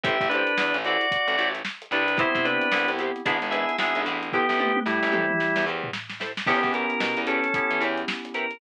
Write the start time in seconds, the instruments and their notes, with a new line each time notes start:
0.04 electric bass (finger) A1, acoustic guitar (steel) E4 G4 A4 C5, drawbar organ G4 E5, kick, closed hi-hat
0.20 electric bass (finger) A1, kick, closed hi-hat
0.29 drawbar organ D4 B4, acoustic guitar (steel) E4 G4, closed hi-hat
0.34 acoustic guitar (steel) A4 C5
0.47 closed hi-hat
0.58 electric bass (finger) E2, snare
0.74 electric bass (finger) A1, closed hi-hat
0.85 acoustic guitar (steel) E4 G4 A4 C5, drawbar organ F#4 D5, closed hi-hat
1.01 closed hi-hat
1.11 kick, closed hi-hat
1.27 electric bass (finger) A1, closed hi-hat
1.38 electric bass (finger) A1, acoustic guitar (steel) E4 G4 A4 C5, closed hi-hat
1.54 snare, closed hi-hat
1.65 snare
1.82 closed hi-hat
1.91 electric bass (finger) C2, drawbar organ D4 B4, acoustic guitar (steel) E4 G4 A4 C5, closed hi-hat
2.08 closed hi-hat
2.17 electric piano 2 B3 C4 E4 G4, acoustic guitar (steel) E4 G4 B4 C5, drawbar organ E4 C5, kick, closed hi-hat
2.35 electric bass (finger) C3, kick, closed hi-hat
2.45 drawbar organ D4 B4, acoustic guitar (steel) E4 G4 B4 C5, closed hi-hat
2.61 closed hi-hat
2.72 electric bass (finger) C2, electric piano 2 B3 C4 E4 G4, snare
2.88 electric bass (finger) C2, closed hi-hat
2.99 acoustic guitar (steel) E4 G4 B4 C5, closed hi-hat
3.16 closed hi-hat
3.25 electric bass (finger) G#1, electric piano 2 B3 D4 E4 G#4, acoustic guitar (steel) D4 E4 G#4 B4, kick, closed hi-hat
3.42 electric bass (finger) G#1, closed hi-hat
3.51 acoustic guitar (steel) D4 E4 G#4 B4, drawbar organ G#4 E5, closed hi-hat
3.69 closed hi-hat
3.79 electric bass (finger) G#1, electric piano 2 B3 D4 E4 G#4, drawbar organ G#4 E5, snare
3.95 electric bass (finger) G#1, closed hi-hat
4.06 electric bass (finger) A1, acoustic guitar (steel) D4 E4 G#4 B4, snare, closed hi-hat
4.23 closed hi-hat
4.33 drawbar organ B3 G4, acoustic guitar (steel) E4 G4 A4 C5, kick
4.49 electric bass (finger) A1, snare
4.58 acoustic guitar (steel) E4 G4 A4 C5, high tom
4.76 high tom
4.86 electric bass (finger) A2, drawbar organ G3 E4, snare
5.03 electric bass (finger) A1, snare
5.12 acoustic guitar (steel) E4 G4 A4 C5, mid tom
5.30 mid tom
5.40 snare
5.56 electric bass (finger) E2, snare
5.66 electric bass (finger) E2, acoustic guitar (steel) E4 G4 A4 C5
5.84 floor tom
5.93 snare
6.10 snare
6.20 acoustic guitar (steel) E4 G4 A4 C5, snare
6.37 snare
6.47 electric bass (finger) E2, electric piano 2 B3 C#4 E4 G4, drawbar organ B3 G4, acoustic guitar (steel) E4 G4 B4 C#5, kick, crash
6.63 electric bass (finger) E2, kick, closed hi-hat
6.73 acoustic guitar (steel) E4 G4 B4 C#5, drawbar organ A#4, closed hi-hat
6.90 closed hi-hat
7.00 electric bass (finger) B2, snare
7.17 electric bass (finger) E2, closed hi-hat
7.27 drawbar organ C#4 A4, acoustic guitar (steel) E4 G4 B4 C#5, closed hi-hat
7.44 closed hi-hat
7.54 electric piano 2 B3 C#4 E4 G4, kick, closed hi-hat
7.71 electric bass (finger) E3, closed hi-hat
7.80 electric bass (finger) E2, acoustic guitar (steel) E4 G4 B4 C#5, closed hi-hat
7.98 closed hi-hat
8.08 snare
8.25 closed hi-hat
8.34 acoustic guitar (steel) E4 G4 B4 C#5, drawbar organ A#4, closed hi-hat
8.51 closed hi-hat